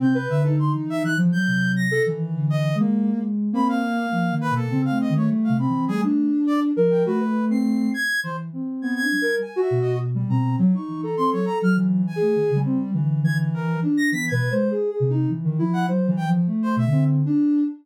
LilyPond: <<
  \new Staff \with { instrumentName = "Ocarina" } { \time 6/4 \tempo 4 = 102 c'16 b'8 dis'4~ dis'16 f16 fis4 a'16 e4~ e16 ais8. r8 | ais4 ais4 c'8. a8. c'8 g16 d'4~ d'16 ais'8 | fis'16 b'8 c'8. r4. \tuplet 3/2 { b8 d'8 ais'8 } r16 fis'8. r16 g16 c'8 | fis16 dis'8 a'4~ a'16 \tuplet 3/2 { e4 gis'4 g4 } e8 e4 d'8 |
\tuplet 3/2 { e8 b'8 c''8 gis'8 gis'8 dis'8 } r16 dis16 e'8 \tuplet 3/2 { c''8 e8 f8 a4 d4 d'4 } | }
  \new Staff \with { instrumentName = "Brass Section" } { \time 6/4 g'''8 e''16 a'16 c'''16 r16 e''16 fis'''16 r16 g'''8. ais'''8 r8. dis''8 r4 r16 | b''16 f''4~ f''16 b'16 a'8 f''16 dis''16 cis''16 r16 f''16 b''8 gis'16 r8. d''16 r8 g''16 | b'8. c''''8. gis'''8 c''16 r8. gis'''16 gis'''8. \tuplet 3/2 { gis''8 e''8 dis''8 } r8 ais''8 | r16 cis'''8 ais''16 c'''16 cis''16 ais''16 f'''16 r8 gis''4 r4 gis'''16 r16 ais'8 r16 ais'''16 |
b'''16 gis'''8 r2 fis''16 r8 g''16 r8 c''16 e''8 r4 | }
  \new Staff \with { instrumentName = "Ocarina" } { \time 6/4 c8 d8. e8 e16 r8 c4 dis8 \tuplet 3/2 { d4 gis4 gis4 } | c'8 r8 \tuplet 3/2 { f8 dis8 b,8 cis8 a8 dis8 g8 c8 e8 } a8. r8. f8 | a4. r8 e8 c'4 g8 r8 b,4 b,8 | r8 e8 c'16 fis16 r16 fis8. r16 a16 dis16 cis16 c'16 r16 d4 r4 |
\tuplet 3/2 { b8 b,8 gis8 } r8 c8 e8 f8 fis8 r4 b,16 c'8 r8. | }
>>